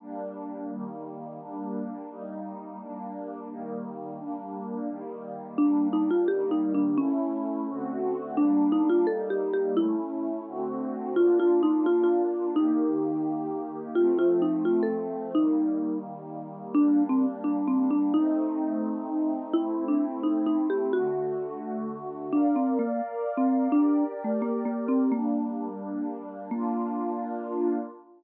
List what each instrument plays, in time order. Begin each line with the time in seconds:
0.00 pad 5 (bowed) G3 A#3 D4
0.69 pad 5 (bowed) D#3 G3 A#3
1.40 pad 5 (bowed) G3 A#3 D4
2.09 pad 5 (bowed) G3 A#3 D#4
2.79 pad 5 (bowed) G3 A#3 D4
3.49 pad 5 (bowed) D#3 G3 A#3
4.18 pad 5 (bowed) G3 A#3 D4
4.88 pad 5 (bowed) D#3 G3 A#3
5.58 pad 5 (bowed) G3 A#3 D4, marimba D4
5.93 marimba D#4
6.11 marimba F4
6.28 pad 5 (bowed) D#3 G3 A#3, marimba G4
6.51 marimba D#4
6.74 marimba D4
6.98 pad 5 (bowed) A3 C#4 E4, marimba C#4
7.68 pad 5 (bowed) D3 A3 C4 F#4
8.37 pad 5 (bowed) G3 A#3 D4, marimba D4
8.72 marimba D#4
8.90 marimba F4
9.07 pad 5 (bowed) G3 A#3 D#4, marimba A4
9.30 marimba G4
9.53 marimba G4
9.77 pad 5 (bowed) A3 C#4 E4, marimba E4
10.47 pad 5 (bowed) D3 A3 C4 F#4
11.16 pad 5 (bowed) A#3 D4 F4, marimba F4
11.40 marimba F4
11.63 marimba D#4
11.86 marimba F4
12.03 marimba F4
12.56 pad 5 (bowed) D#3 A#3 G4, marimba D#4
13.95 pad 5 (bowed) F3 A3 C4, marimba F4
14.19 marimba F4
14.42 marimba D#4
14.65 marimba F4
14.83 marimba A4
15.35 pad 5 (bowed) D#3 G3 A#3, marimba D#4
16.74 pad 5 (bowed) G3 A#3 D4, marimba D4
17.09 marimba C4
17.44 marimba D4
17.68 marimba C4
17.91 marimba D4
18.14 pad 5 (bowed) A3 C4 D#4, marimba D#4
19.53 pad 5 (bowed) A3 C4 E4, marimba E4
19.88 marimba D4
20.23 marimba D#4
20.46 marimba D#4
20.70 marimba G4
20.93 pad 5 (bowed) D3 A3 F#4, marimba F#4
22.33 marimba D4, pad 5 (bowed) A#4 D5 F5
22.56 marimba C4
22.79 marimba A#3
23.37 marimba C4
23.72 marimba D4, pad 5 (bowed) G4 A#4 D5
24.24 marimba A3
24.42 marimba A#3
24.65 marimba A#3
24.88 marimba C4
25.12 pad 5 (bowed) G3 A#3 D4, marimba A#3
26.51 pad 5 (bowed) A#3 D4 F4, marimba A#3